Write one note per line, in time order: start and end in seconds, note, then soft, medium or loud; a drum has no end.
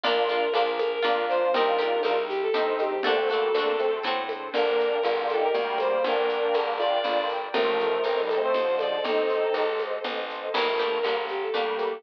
0.04 0.49 A#1 medium
0.04 0.16 A#3 medium
0.04 0.78 A#3 medium
0.04 0.26 A#3 loud
0.04 0.16 D4 medium
0.04 0.79 D4 medium
0.04 0.26 D4 loud
0.04 0.26 F4 medium
0.04 0.78 F4 medium
0.04 0.71 A#4 loud
0.04 low conga medium
0.04 shaker medium
0.17 0.47 D4 medium
0.17 0.47 F4 medium
0.28 0.52 A#3 medium
0.28 0.52 D4 medium
0.28 0.52 F4 medium
0.28 high conga medium
0.28 shaker medium
0.54 0.99 A#1 medium
0.54 1.00 A#3 medium
0.54 0.67 D4 medium
0.54 1.00 D4 medium
0.54 1.00 F4 medium
0.54 0.67 F4 medium
0.54 high conga medium
0.54 shaker medium
0.79 1.53 A#3 medium
0.79 1.53 F4 medium
0.79 1.53 A#4 medium
0.79 0.91 A#4 medium
0.79 high conga medium
0.79 shaker medium
0.92 1.25 A#4 medium
1.02 1.49 F2 medium
1.02 1.49 A#3 medium
1.02 1.49 D4 medium
1.02 1.50 D4 medium
1.02 1.49 F4 medium
1.02 1.50 F4 medium
1.02 low conga medium
1.02 shaker medium
1.29 1.51 C5 loud
1.29 shaker soft
1.54 1.99 C2 medium
1.54 2.28 C4 medium
1.54 1.78 C4 medium
1.54 2.28 D#4 medium
1.54 1.66 D#4 medium
1.54 1.78 D#4 loud
1.54 2.28 G4 medium
1.54 1.66 G4 medium
1.54 1.78 G4 medium
1.54 2.19 A#4 loud
1.54 low conga medium
1.54 shaker medium
1.66 2.01 D4 medium
1.66 2.01 F4 medium
1.79 2.02 C4 medium
1.79 2.02 D#4 medium
1.79 2.02 G4 medium
1.79 high conga medium
1.79 shaker medium
2.03 2.49 C2 medium
2.03 2.49 C4 medium
2.03 2.16 D4 medium
2.03 2.49 D#4 medium
2.03 2.16 F4 medium
2.03 2.49 G4 medium
2.03 high conga medium
2.03 shaker medium
2.28 3.03 G3 medium
2.28 3.03 C4 medium
2.28 2.40 G4 loud
2.28 3.03 G4 medium
2.28 shaker medium
2.42 2.73 A4 medium
2.54 2.99 G2 medium
2.54 2.94 C4 medium
2.54 3.00 C4 medium
2.54 2.94 D#4 medium
2.54 3.00 D#4 medium
2.54 3.00 G4 medium
2.54 low conga medium
2.54 shaker medium
2.79 3.00 G4 medium
2.79 high conga medium
2.79 shaker medium
3.03 3.49 D2 medium
3.03 3.17 A#3 medium
3.03 3.79 C4 medium
3.03 3.17 D4 medium
3.03 3.79 D4 medium
3.03 3.27 D4 loud
3.03 3.79 F#4 medium
3.03 3.27 F#4 medium
3.03 3.27 A4 medium
3.03 3.79 A4 medium
3.03 3.93 A4 loud
3.03 low conga medium
3.03 shaker soft
3.08 3.27 C4 medium
3.16 3.28 A3 medium
3.16 3.28 C4 medium
3.29 3.50 G3 medium
3.29 3.50 A#3 medium
3.29 3.53 D4 medium
3.29 3.53 F#4 medium
3.29 3.53 A4 medium
3.29 high conga medium
3.29 shaker medium
3.34 3.53 C4 medium
3.54 3.99 D2 medium
3.54 3.76 A#3 medium
3.54 3.76 D4 medium
3.54 4.02 D4 medium
3.54 4.02 F#4 medium
3.54 4.02 A4 medium
3.54 high conga medium
3.54 shaker medium
3.59 4.02 C4 medium
3.78 4.03 A3 medium
3.78 4.03 C4 medium
3.78 4.53 C4 medium
3.78 4.53 D4 medium
3.78 4.53 A4 medium
3.78 4.53 C5 medium
3.78 high conga medium
3.78 shaker soft
4.03 4.49 A2 medium
4.03 4.49 C4 loud
4.03 4.49 D4 medium
4.03 4.49 F#4 medium
4.03 4.49 A4 medium
4.03 low conga medium
4.03 shaker medium
4.29 high conga medium
4.29 shaker soft
4.53 4.99 G1 medium
4.53 4.98 A#3 medium
4.53 4.98 D4 medium
4.53 5.14 A#4 loud
4.53 7.50 A#4 medium
4.53 7.50 D5 medium
4.53 7.50 G5 medium
4.53 low conga medium
4.53 shaker medium
4.80 shaker medium
5.03 5.49 G1 medium
5.03 5.20 D4 medium
5.03 5.20 F4 medium
5.03 high conga medium
5.03 shaker medium
5.21 5.37 D4 medium
5.21 5.37 F4 medium
5.29 5.41 A4 medium
5.29 shaker medium
5.38 5.53 D#4 medium
5.38 5.53 G4 medium
5.38 5.75 A#4 medium
5.54 5.99 D2 medium
5.54 6.02 G3 medium
5.54 6.02 A#3 medium
5.54 low conga medium
5.54 shaker medium
5.78 6.03 C5 medium
5.78 high conga medium
5.78 shaker medium
6.04 6.49 G1 medium
6.04 6.73 A#3 medium
6.04 6.73 D4 medium
6.04 6.69 A#4 loud
6.04 low conga medium
6.04 shaker medium
6.29 shaker medium
6.54 6.99 G1 medium
6.54 high conga medium
6.54 shaker medium
6.78 7.28 D4 medium
6.78 7.28 F4 medium
6.78 6.91 D5 medium
6.78 high conga medium
6.78 shaker soft
6.92 7.28 D5 medium
7.04 7.49 G1 medium
7.04 low conga medium
7.04 shaker medium
7.29 shaker soft
7.54 7.99 A1 medium
7.54 8.01 F3 medium
7.54 8.01 A3 medium
7.54 10.51 A4 medium
7.54 8.21 A#4 loud
7.54 10.51 C5 medium
7.54 10.51 D#5 medium
7.54 low conga medium
7.54 shaker medium
7.80 shaker medium
8.03 8.49 A1 medium
8.03 8.20 A3 medium
8.03 8.20 C4 medium
8.03 high conga medium
8.03 shaker medium
8.21 8.37 D#3 medium
8.21 8.37 G3 medium
8.29 8.41 A4 medium
8.29 high conga medium
8.29 shaker medium
8.37 8.53 A3 medium
8.37 8.53 C4 medium
8.42 8.75 C5 medium
8.54 8.99 D#2 medium
8.54 8.99 D3 soft
8.54 8.99 F3 medium
8.54 low conga medium
8.54 shaker medium
8.79 9.01 D5 medium
8.79 high conga medium
8.79 shaker medium
9.04 9.49 A1 medium
9.04 9.65 C4 medium
9.04 9.65 D#4 medium
9.04 9.76 A4 loud
9.04 low conga medium
9.04 shaker medium
9.29 shaker medium
9.54 9.99 A1 medium
9.54 high conga medium
9.54 shaker medium
9.79 high conga medium
9.79 shaker soft
10.04 10.49 A1 medium
10.04 low conga medium
10.04 shaker medium
10.29 shaker soft
10.54 10.99 G1 medium
10.54 10.66 D#3 medium
10.54 10.66 G3 medium
10.54 11.28 A#3 medium
10.54 10.77 A#3 medium
10.54 11.28 D4 medium
10.54 10.77 D4 medium
10.54 11.28 G4 medium
10.54 10.77 G4 medium
10.54 11.18 A#4 medium
10.54 crash medium
10.54 low conga medium
10.54 shaker medium
10.67 10.99 F3 soft
10.67 10.99 A3 medium
10.78 11.02 A#3 medium
10.78 11.02 D4 medium
10.78 11.02 G4 medium
10.78 high conga soft
10.78 shaker medium
11.03 11.49 G1 medium
11.03 11.17 G3 soft
11.03 11.17 A#3 medium
11.03 11.51 D4 medium
11.03 11.51 G4 medium
11.03 high conga medium
11.03 shaker medium
11.08 11.51 A#3 medium
11.28 12.03 G3 medium
11.28 12.03 A#3 medium
11.28 12.03 G4 medium
11.28 11.41 G4 medium
11.28 shaker soft
11.42 11.75 A4 medium
11.54 11.99 D2 soft
11.54 11.94 G3 medium
11.54 11.94 A#3 medium
11.54 12.00 A#3 medium
11.54 12.00 D4 medium
11.54 12.00 G4 medium
11.54 low conga medium
11.54 shaker medium
11.78 12.03 A4 medium
11.78 high conga medium
11.78 shaker medium